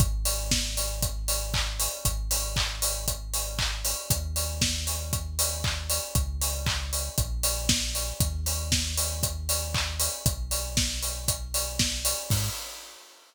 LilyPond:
<<
  \new Staff \with { instrumentName = "Synth Bass 2" } { \clef bass \time 4/4 \key gis \minor \tempo 4 = 117 gis,,1 | gis,,1 | dis,1 | cis,2 ais,,2 |
dis,1 | b,,1 | gis,4 r2. | }
  \new DrumStaff \with { instrumentName = "Drums" } \drummode { \time 4/4 <hh bd>8 hho8 <bd sn>8 hho8 <hh bd>8 hho8 <hc bd>8 hho8 | <hh bd>8 hho8 <hc bd>8 hho8 <hh bd>8 hho8 <hc bd>8 hho8 | <hh bd>8 hho8 <bd sn>8 hho8 <hh bd>8 hho8 <hc bd>8 hho8 | <hh bd>8 hho8 <hc bd>8 hho8 <hh bd>8 hho8 <bd sn>8 hho8 |
<hh bd>8 hho8 <bd sn>8 hho8 <hh bd>8 hho8 <hc bd>8 hho8 | <hh bd>8 hho8 <bd sn>8 hho8 <hh bd>8 hho8 <bd sn>8 hho8 | <cymc bd>4 r4 r4 r4 | }
>>